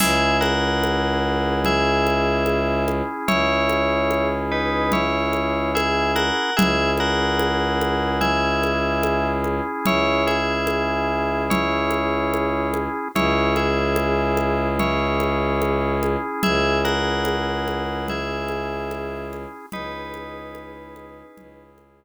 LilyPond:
<<
  \new Staff \with { instrumentName = "Tubular Bells" } { \time 4/4 \key cis \dorian \tempo 4 = 73 <gis' e''>8 <ais' fis''>4. <gis' e''>4. r8 | <e' cis''>4. <dis' b'>8 <e' cis''>4 <gis' e''>8 <ais' fis''>8 | <gis' e''>8 <ais' fis''>4. <gis' e''>4. r8 | <e' cis''>8 <gis' e''>4. <e' cis''>4. r8 |
<e' cis''>8 <gis' e''>4. <e' cis''>4. r8 | <gis' e''>8 <ais' fis''>4. <gis' e''>4. r8 | <dis' b'>2~ <dis' b'>8 r4. | }
  \new Staff \with { instrumentName = "Drawbar Organ" } { \time 4/4 \key cis \dorian <cis' e' gis'>1~ | <cis' e' gis'>1 | <cis' e' gis'>1~ | <cis' e' gis'>1 |
<cis' e' gis'>1~ | <cis' e' gis'>1 | <cis' e' gis'>1 | }
  \new Staff \with { instrumentName = "Violin" } { \clef bass \time 4/4 \key cis \dorian cis,1 | cis,1 | cis,1 | cis,1 |
cis,1 | cis,1 | cis,2 cis,2 | }
  \new DrumStaff \with { instrumentName = "Drums" } \drummode { \time 4/4 <cgl cymc>8 cgho8 cgho4 cgl8 cgho8 cgho8 cgho8 | cgl8 cgho8 cgho4 cgl8 cgho8 cgho8 cgho8 | cgl8 cgho8 cgho8 cgho8 cgl8 cgho8 cgho8 cgho8 | cgl8 cgho8 cgho4 cgl8 cgho8 cgho8 cgho8 |
cgl8 cgho8 cgho8 cgho8 cgl8 cgho8 cgho8 cgho8 | cgl8 cgho8 cgho8 cgho8 cgl8 cgho8 cgho8 cgho8 | cgl8 cgho8 cgho8 cgho8 cgl8 cgho8 r4 | }
>>